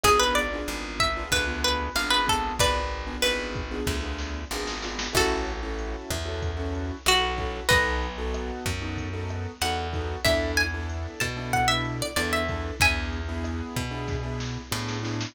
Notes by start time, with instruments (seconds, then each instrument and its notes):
0.04 electric bass (finger) G#1, acoustic grand piano B3 D4 F4 G#4, acoustic guitar (steel) G#4, kick, cross-stick, closed hi-hat
0.20 acoustic guitar (steel) B4
0.35 acoustic guitar (steel) D5, closed hi-hat
0.53 acoustic grand piano B3 D4 F4 G#4
0.68 electric bass (finger) G#1, closed hi-hat
1.00 acoustic guitar (steel) E5, kick, cross-stick, closed hi-hat
1.17 acoustic grand piano B3 D4 F4 G#4
1.31 electric bass (finger) D2, acoustic guitar (steel) B4, kick, closed hi-hat
1.47 acoustic grand piano B3 D4 F4 G#4
1.64 acoustic guitar (steel) B4, closed hi-hat
1.95 electric bass (finger) G#1, acoustic grand piano B3 D4 F4 G#4, acoustic guitar (steel) F5, cross-stick, closed hi-hat
2.11 acoustic guitar (steel) B4
2.26 acoustic grand piano B3 D4 F4 G#4, acoustic guitar (steel) A4, kick, closed hi-hat
2.59 electric bass (finger) G#1, acoustic guitar (steel) B4 D5, kick, closed hi-hat
2.91 closed hi-hat
3.07 acoustic grand piano B3 D4 F4 G#4
3.22 electric bass (finger) G#1, acoustic guitar (steel) B4, cross-stick, closed hi-hat
3.55 kick, closed hi-hat
3.71 acoustic grand piano B3 D4 F4 G#4
3.87 electric bass (finger) D2, kick, snare
4.03 acoustic grand piano B3 D4 F4 G#4
4.18 snare
4.51 electric bass (finger) G#1, acoustic grand piano B3 D4 F4 G#4, snare
4.67 snare
4.82 acoustic grand piano B3 D4 F4 G#4, snare
4.99 snare
5.13 electric bass (finger) A1, acoustic grand piano C#4 E4 F#4 A4, acoustic guitar (steel) F#4 A4, kick, cross-stick, crash
5.47 closed hi-hat
5.63 acoustic grand piano C#4 E4 F#4 A4
5.79 closed hi-hat
6.11 electric bass (finger) E2, kick, cross-stick, closed hi-hat
6.25 acoustic grand piano C#4 E4 F#4 A4
6.42 kick, closed hi-hat
6.57 acoustic grand piano C#4 E4 F#4 A4
6.75 closed hi-hat
7.06 electric bass (finger) B1, acoustic grand piano C#4 E4 F#4 A4, acoustic guitar (steel) F#4, cross-stick, closed hi-hat
7.38 acoustic grand piano C#4 E4 F#4 A4, kick, closed hi-hat
7.69 electric bass (finger) B1, acoustic grand piano B3 D#4 F#4 A4, acoustic guitar (steel) B4 D#5, kick, closed hi-hat
8.02 closed hi-hat
8.18 acoustic grand piano B3 D#4 F#4 A4
8.34 cross-stick, closed hi-hat
8.66 electric bass (finger) F#2, kick, closed hi-hat
8.82 acoustic grand piano B3 D#4 F#4 A4
8.97 kick, closed hi-hat
9.13 acoustic grand piano B3 D#4 F#4 A4
9.29 cross-stick, closed hi-hat
9.61 electric bass (finger) E2, acoustic grand piano B3 D#4 F#4 A4, acoustic guitar (steel) F#5, closed hi-hat
9.93 acoustic grand piano B3 D#4 F#4 A4, kick, closed hi-hat
10.25 electric bass (finger) E2, acoustic grand piano B3 D4 E4 A4, acoustic guitar (steel) E5, kick, cross-stick, closed hi-hat
10.57 acoustic guitar (steel) G#5, closed hi-hat
10.74 acoustic grand piano B3 D4 E4 A4
10.89 closed hi-hat
11.20 electric bass (finger) B2, acoustic guitar (steel) A5, kick, cross-stick, closed hi-hat
11.37 acoustic grand piano B3 D4 E4 A4
11.53 acoustic guitar (steel) F#5, kick, closed hi-hat
11.68 acoustic grand piano B3 D4 E4 A4, acoustic guitar (steel) E5
11.85 closed hi-hat
12.02 acoustic guitar (steel) D5
12.16 electric bass (finger) E2, acoustic grand piano B3 D4 E4 A4, acoustic guitar (steel) D5, cross-stick, closed hi-hat
12.33 acoustic guitar (steel) E5
12.48 acoustic grand piano B3 D4 E4 A4, kick, closed hi-hat
12.80 electric bass (finger) E2, acoustic grand piano B3 D4 E4 G#4, acoustic guitar (steel) E5 G#5, kick, closed hi-hat
13.12 closed hi-hat
13.29 acoustic grand piano B3 D4 E4 G#4
13.44 cross-stick, closed hi-hat
13.76 electric bass (finger) B2, kick, closed hi-hat
13.91 acoustic grand piano B3 D4 E4 G#4
14.08 kick, snare
14.23 acoustic grand piano B3 D4 E4 G#4
14.40 snare
14.72 electric bass (finger) A2, acoustic grand piano B3 D4 E4 G#4, snare
14.88 snare
15.03 acoustic grand piano B3 D4 E4 G#4, snare
15.21 snare